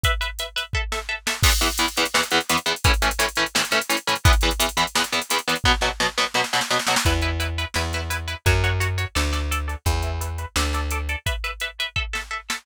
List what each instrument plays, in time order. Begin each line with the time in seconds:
0.04 overdriven guitar B4 E5, kick, closed hi-hat
0.21 overdriven guitar B4 E5, closed hi-hat
0.39 overdriven guitar B4 E5, closed hi-hat
0.56 overdriven guitar B4 E5, closed hi-hat
0.73 overdriven guitar A4 E5, kick
0.92 overdriven guitar A4 E5, snare
1.09 overdriven guitar A4 E5
1.27 overdriven guitar A4 E5, snare
1.43 overdriven guitar E2 E3 B3, kick, crash
1.52 closed hi-hat
1.61 overdriven guitar E2 E3 B3, closed hi-hat
1.72 closed hi-hat
1.78 overdriven guitar E2 E3 B3, closed hi-hat
1.88 closed hi-hat
1.97 overdriven guitar E2 E3 B3, closed hi-hat
2.05 closed hi-hat
2.14 overdriven guitar E2 E3 B3, snare
2.23 closed hi-hat
2.31 overdriven guitar E2 E3 B3, snare, closed hi-hat
2.41 closed hi-hat
2.49 overdriven guitar E2 E3 B3, closed hi-hat
2.57 closed hi-hat
2.66 overdriven guitar E2 E3 B3, closed hi-hat
2.76 closed hi-hat
2.84 overdriven guitar A2 E3 C#4, kick, closed hi-hat
2.94 closed hi-hat
3.02 overdriven guitar A2 E3 C#4, closed hi-hat
3.11 closed hi-hat
3.19 overdriven guitar A2 E3 C#4, closed hi-hat
3.29 closed hi-hat
3.36 overdriven guitar A2 E3 C#4, closed hi-hat
3.46 closed hi-hat
3.55 overdriven guitar A2 E3 C#4, snare
3.65 closed hi-hat
3.71 overdriven guitar A2 E3 C#4, snare, closed hi-hat
3.81 closed hi-hat
3.89 overdriven guitar A2 E3 C#4, closed hi-hat
3.97 closed hi-hat
4.07 overdriven guitar A2 E3 C#4, closed hi-hat
4.15 closed hi-hat
4.25 overdriven guitar E2 E3 B3, kick, closed hi-hat
4.33 closed hi-hat
4.41 overdriven guitar E2 E3 B3, closed hi-hat
4.51 closed hi-hat
4.60 overdriven guitar E2 E3 B3, closed hi-hat
4.69 closed hi-hat
4.77 overdriven guitar E2 E3 B3, closed hi-hat
4.87 closed hi-hat
4.95 overdriven guitar E2 E3 B3, snare
5.04 closed hi-hat
5.12 overdriven guitar E2 E3 B3, snare, closed hi-hat
5.22 closed hi-hat
5.30 overdriven guitar E2 E3 B3, closed hi-hat
5.38 closed hi-hat
5.48 overdriven guitar E2 E3 B3, closed hi-hat
5.56 closed hi-hat
5.64 overdriven guitar B2 F#3 B3, kick, snare
5.81 overdriven guitar B2 F#3 B3, snare
6.00 overdriven guitar B2 F#3 B3, snare
6.18 overdriven guitar B2 F#3 B3, snare
6.34 overdriven guitar B2 F#3 B3, snare
6.44 snare
6.53 overdriven guitar B2 F#3 B3, snare
6.61 snare
6.70 overdriven guitar B2 F#3 B3, snare
6.79 snare
6.87 overdriven guitar B2 F#3 B3, snare
6.96 snare
7.05 electric bass (finger) E2, overdriven guitar E4 B4, kick, closed hi-hat
7.22 overdriven guitar E4 B4, closed hi-hat
7.40 overdriven guitar E4 B4, closed hi-hat
7.58 overdriven guitar E4 B4, closed hi-hat
7.74 electric bass (finger) E2, overdriven guitar E4 B4, snare
7.93 overdriven guitar E4 B4, snare, closed hi-hat
8.10 overdriven guitar E4 B4, closed hi-hat
8.28 overdriven guitar E4 B4, closed hi-hat
8.46 electric bass (finger) F#2, overdriven guitar F#4 C#5, kick, closed hi-hat
8.64 overdriven guitar F#4 C#5, closed hi-hat
8.80 overdriven guitar F#4 C#5, closed hi-hat
8.98 overdriven guitar F#4 C#5, closed hi-hat
9.15 electric bass (finger) D2, overdriven guitar A4 D5, snare
9.33 overdriven guitar A4 D5, snare, closed hi-hat
9.51 overdriven guitar A4 D5, closed hi-hat
9.68 overdriven guitar A4 D5, closed hi-hat
9.86 electric bass (finger) E2, overdriven guitar B4 E5, kick, closed hi-hat
10.02 overdriven guitar B4 E5, closed hi-hat
10.21 overdriven guitar B4 E5, closed hi-hat
10.38 overdriven guitar B4 E5, closed hi-hat
10.56 electric bass (finger) D2, overdriven guitar A4 D5, snare
10.73 overdriven guitar A4 D5, snare, closed hi-hat
10.91 overdriven guitar A4 D5, closed hi-hat
11.09 overdriven guitar A4 D5, closed hi-hat
11.26 overdriven guitar B4 E5, kick, closed hi-hat
11.44 overdriven guitar B4 E5, closed hi-hat
11.60 overdriven guitar B4 E5, closed hi-hat
11.80 overdriven guitar B4 E5, closed hi-hat
11.96 overdriven guitar A4 E5, kick
12.13 overdriven guitar A4 E5, snare
12.31 overdriven guitar A4 E5
12.50 overdriven guitar A4 E5, snare